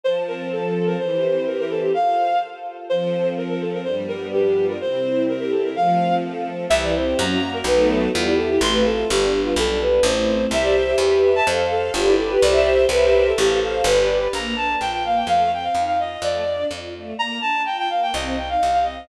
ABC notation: X:1
M:2/4
L:1/16
Q:1/4=126
K:F
V:1 name="Violin"
c z B2 A3 B | c4 B B A G | f4 z4 | c4 B B A B |
c z B2 G3 B | c4 B B A B | f4 z4 | [K:C] e d c2 ^a3 ^A |
B2 A2 F E A G | c' B A2 G3 F | A2 B2 c4 | e d c2 G3 a |
c2 A2 F E A G | d d c2 B3 A | G2 A2 B4 | [K:Bb] b2 a2 g g f g |
f2 g f2 f e2 | d4 z4 | b2 a2 g g f g | e2 g f2 f e2 |]
V:2 name="String Ensemble 1"
F,2 C2 A2 C2 | E,2 C2 G2 C2 | z8 | F,2 C2 A2 C2 |
G,2 =B,2 D2 F2 | C2 E2 G2 E2 | F,2 C2 A2 C2 | [K:C] E,2 C2 ^F,2 ^A,2 |
[^F,A,B,^D]4 G,2 E2 | A,2 F2 G,2 B,2 | z8 | [Gce]4 G2 e2 |
A2 f2 G2 B2 | [Gce]4 [G_Bce]4 | A2 f2 G2 B2 | [K:Bb] B,2 D2 F2 B,2 |
A,2 C2 E2 F2 | A,2 D2 F2 A,2 | B,2 D2 F2 B,2 | C2 E2 G2 C2 |]
V:3 name="Electric Bass (finger)" clef=bass
z8 | z8 | z8 | z8 |
z8 | z8 | z8 | [K:C] C,,4 ^F,,4 |
B,,,4 E,,4 | A,,,4 G,,,4 | B,,,4 A,,,4 | C,,4 E,,4 |
F,,4 G,,,4 | C,,4 C,,4 | A,,,4 G,,,4 | [K:Bb] B,,,4 B,,,4 |
F,,4 F,,4 | F,,4 F,,4 | z8 | C,,4 C,,4 |]
V:4 name="String Ensemble 1"
[Fca]8 | [EGc]8 | [FAc]8 | [F,CA]8 |
[G,,F,=B,D]8 | [C,G,E]8 | [F,A,C]8 | [K:C] [CEG]4 [^A,^C^F]4 |
[A,B,^D^F]4 [B,EG]4 | [A,CF]4 [G,B,D]4 | [G,B,D]4 [A,CE]4 | [Gce]4 [GBe]4 |
[Acf]4 [GBd]4 | [Gce]4 [G_Bce]4 | [Acf]4 [GBd]4 | [K:Bb] z8 |
z8 | z8 | z8 | z8 |]